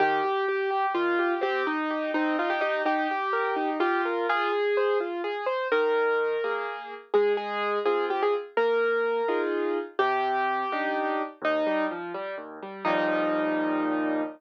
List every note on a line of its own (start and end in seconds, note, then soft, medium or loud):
0.00 0.21 D#3 loud
0.00 0.86 G4 medium
0.24 0.46 G4 medium
0.49 0.70 G4 medium
0.71 0.92 G4 medium
0.94 1.17 D#3 medium
0.94 1.34 F4 medium
1.19 1.40 G4 medium
1.41 1.63 C4 loud
1.41 1.66 G4 medium
1.67 2.11 D#4 medium
1.90 2.12 G4 medium
2.14 2.36 C4 medium
2.14 2.37 D#4 medium
2.39 2.61 D#4 medium
2.39 2.50 F4 medium
2.50 2.61 G4 medium
2.61 2.82 D#4 medium
2.61 2.83 G4 medium
2.85 3.07 D#4 medium
2.85 3.70 G4 medium
3.11 3.32 G4 medium
3.33 3.54 A#4 medium
3.56 3.78 D#4 medium
3.80 4.27 F4 medium
3.80 4.02 G4 medium
4.05 4.27 A#4 medium
4.29 4.51 F4 loud
4.29 4.98 G#4 medium
4.52 4.74 G#4 medium
4.77 4.99 C5 medium
5.00 5.22 F4 medium
5.24 5.45 G#4 medium
5.46 5.68 C5 medium
5.72 6.36 D#3 loud
5.72 6.53 A#4 medium
6.44 6.94 A#3 medium
6.44 6.94 G#4 medium
7.14 7.79 G#3 loud
7.14 7.33 G#4 medium
7.37 7.78 G#4 medium
7.86 8.36 C4 medium
7.86 8.36 F4 medium
7.86 8.05 G#4 medium
8.10 8.21 G4 medium
8.23 8.34 G#4 medium
8.57 9.21 A#3 medium
8.57 9.41 A#4 medium
9.28 9.78 D#4 medium
9.28 9.78 F4 medium
9.28 9.78 G#4 medium
9.99 10.64 C3 medium
9.99 10.87 G4 loud
10.72 11.22 D4 medium
10.72 11.22 D#4 medium
10.72 11.22 G4 medium
11.42 11.63 D#2 loud
11.42 11.85 D#4 medium
11.67 11.88 G3 medium
11.91 12.12 F3 medium
12.14 12.36 G3 medium
12.38 12.59 D#2 medium
12.62 12.84 G3 medium
12.85 14.23 D#2 loud
12.85 14.23 A#2 medium
12.85 14.23 F3 medium
12.85 14.23 G3 medium
12.85 14.22 D#4 loud